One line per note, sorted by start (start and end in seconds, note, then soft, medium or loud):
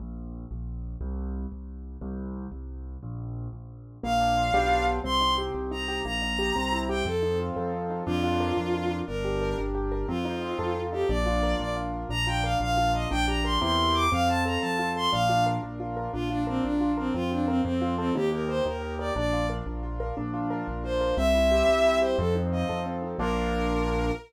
0.00 0.45 A#1 medium
0.51 0.96 A#1 medium
1.01 1.46 C2 medium
1.52 1.97 C2 soft
2.01 2.47 C2 medium
2.52 2.97 C2 medium
3.03 3.48 A#1 medium
3.53 3.98 A#1 medium
4.03 4.50 A#1 medium
4.03 4.51 A#3 medium
4.03 4.85 F5 medium
4.20 4.52 D4 medium
4.37 4.53 F4 medium
4.54 5.00 B1 medium
4.54 4.99 B3 medium
4.54 4.99 D4 loud
4.54 4.99 F4 medium
4.54 4.99 G4 medium
5.04 5.49 C2 medium
5.04 5.54 C4 medium
5.04 5.34 C6 medium
5.21 5.71 D#4 medium
5.38 5.88 G4 medium
5.55 6.00 C2 medium
5.55 6.03 C4 medium
5.71 6.03 D#4 medium
5.71 6.00 A#5 medium
5.88 6.04 G4 medium
6.05 6.51 A#1 medium
6.05 6.53 A#3 medium
6.05 6.78 A#5 medium
6.22 6.54 D#4 medium
6.39 6.55 G4 medium
6.55 7.02 C2 medium
6.55 7.03 C4 medium
6.72 7.04 E4 medium
6.89 7.05 G4 medium
6.89 7.04 G5 medium
7.05 7.50 F2 medium
7.05 7.73 C4 medium
7.05 7.38 A4 medium
7.23 7.89 D#4 medium
7.39 8.03 F4 medium
7.56 8.02 F2 medium
7.56 8.04 A4 medium
7.73 8.05 C4 medium
7.90 8.06 D#4 medium
8.06 8.52 F2 loud
8.06 8.57 D4 medium
8.06 8.96 F4 loud
8.24 8.73 F4 medium
8.40 8.90 A#4 medium
8.57 9.02 F2 medium
8.57 9.05 D4 medium
8.74 9.06 F4 medium
8.91 9.07 A#4 medium
9.07 9.54 G1 medium
9.07 9.57 D4 medium
9.07 9.57 A#4 medium
9.24 9.74 G4 medium
9.41 9.91 A#4 medium
9.58 10.04 G1 medium
9.58 10.06 D4 medium
9.75 10.07 G4 medium
9.92 10.08 A#4 medium
10.08 10.54 F2 medium
10.08 10.75 C4 medium
10.08 10.80 F4 medium
10.25 10.92 D#4 medium
10.42 11.06 F4 medium
10.59 11.04 F2 medium
10.59 11.07 A4 medium
10.76 11.08 C4 medium
10.92 11.08 D#4 medium
10.92 11.09 G4 medium
11.09 11.55 A#1 loud
11.09 11.59 D4 medium
11.09 11.57 D5 medium
11.26 11.76 F4 medium
11.43 11.93 A#4 medium
11.59 12.05 A#1 medium
11.59 12.08 D4 medium
11.59 11.75 D5 medium
11.76 12.08 F4 medium
11.93 12.09 A#4 medium
12.09 12.55 A#1 medium
12.09 12.60 D4 medium
12.09 12.26 A#5 loud
12.27 12.77 F4 medium
12.27 12.43 G5 medium
12.44 12.94 A#4 medium
12.44 12.58 F5 medium
12.60 13.06 A#1 medium
12.60 13.08 D4 medium
12.60 12.92 F5 medium
12.77 13.09 F4 medium
12.94 13.10 A#4 medium
12.94 13.08 D#5 medium
13.11 13.58 A#1 medium
13.11 13.59 D4 medium
13.11 13.25 G5 medium
13.28 13.60 G4 medium
13.28 13.43 A#5 medium
13.44 13.61 A#4 medium
13.44 13.59 C6 medium
13.61 14.08 E2 medium
13.61 14.07 C4 medium
13.61 14.07 E4 medium
13.61 14.07 G4 medium
13.61 14.07 A#4 medium
13.61 13.95 C6 medium
13.94 14.10 D6 medium
14.12 14.58 F2 medium
14.12 14.62 C4 medium
14.12 14.28 F5 medium
14.29 14.78 F4 medium
14.29 14.43 A5 medium
14.45 14.95 A4 medium
14.45 14.60 A#5 medium
14.61 15.08 F2 medium
14.61 15.10 C4 medium
14.61 14.89 A5 medium
14.79 15.11 F4 medium
14.96 15.12 A4 medium
14.96 15.11 C6 medium
15.12 15.58 A#1 medium
15.12 15.63 D4 loud
15.12 15.44 F5 medium
15.29 15.79 F4 medium
15.46 15.96 A#4 medium
15.63 16.08 A#1 medium
15.63 16.11 D4 medium
15.80 16.12 F4 medium
15.97 16.13 A#4 medium
16.13 16.59 A#1 medium
16.13 16.63 D4 medium
16.13 16.29 F4 medium
16.30 16.43 D4 medium
16.30 16.80 F4 medium
16.47 16.63 C4 medium
16.47 16.97 A#4 medium
16.64 17.10 A#1 medium
16.64 17.12 D4 medium
16.64 16.92 D4 medium
16.81 17.13 F4 medium
16.97 17.14 C4 medium
16.97 17.13 A#4 medium
17.14 17.61 F2 medium
17.14 17.62 C4 medium
17.14 17.30 F4 medium
17.31 17.46 D4 medium
17.31 17.63 F4 medium
17.48 17.61 C4 medium
17.48 17.64 A#4 medium
17.64 18.11 F2 medium
17.64 17.94 C4 medium
17.64 18.13 C4 medium
17.82 18.13 F4 medium
17.98 18.13 C4 medium
17.98 18.14 A4 medium
18.15 18.61 D#2 loud
18.15 18.65 D#4 medium
18.15 18.29 G4 medium
18.32 18.82 G4 medium
18.32 18.48 A#4 medium
18.49 18.99 A#4 medium
18.49 18.64 C5 medium
18.66 19.11 D#2 medium
18.66 19.13 D#4 medium
18.66 18.94 A#4 medium
18.82 19.14 G4 medium
18.99 19.15 A#4 medium
18.99 19.13 D5 medium
19.16 19.61 A#1 medium
19.16 19.66 D4 medium
19.16 19.47 D5 medium
19.33 19.83 F4 medium
19.50 20.00 A#4 medium
19.66 20.12 A#1 medium
19.66 20.14 D4 medium
19.83 20.15 F4 medium
20.00 20.16 A#4 medium
20.17 20.63 A#1 medium
20.17 20.67 D4 medium
20.34 20.84 F4 medium
20.50 21.00 A#4 medium
20.67 21.13 A#1 medium
20.67 21.15 D4 medium
20.84 21.16 F4 medium
20.84 21.15 C5 medium
21.01 21.17 A#4 medium
21.17 21.63 C2 medium
21.17 21.68 C4 medium
21.17 21.98 E5 loud
21.34 21.84 E4 medium
21.51 22.01 G4 medium
21.68 22.14 C2 medium
21.68 22.16 C4 medium
21.85 22.17 E4 medium
22.01 22.18 G4 medium
22.01 22.16 C5 medium
22.18 22.64 F2 loud
22.18 22.85 C4 medium
22.18 22.34 A4 medium
22.35 23.02 D#4 medium
22.52 23.16 F4 medium
22.52 22.80 D#5 medium
22.69 23.15 F2 medium
22.69 23.17 A4 medium
22.86 23.18 C4 medium
23.03 23.18 D#4 medium
23.19 24.11 A#1 loud
23.19 24.12 A#3 loud
23.19 24.12 D4 loud
23.19 24.12 F4 medium
23.19 24.12 A#4 loud